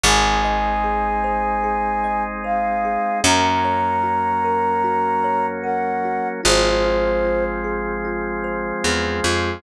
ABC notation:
X:1
M:4/4
L:1/8
Q:1/4=75
K:Gblyd
V:1 name="Flute"
a6 f2 | b6 g2 | c3 z5 |]
V:2 name="Kalimba"
A e A c A e c A | G d G B G d B G | F c F A F c A F |]
V:3 name="Electric Bass (finger)" clef=bass
A,,,8 | G,,8 | A,,,6 =E,, F,, |]
V:4 name="Drawbar Organ"
[A,CE]8 | [G,B,D]8 | [F,A,C]8 |]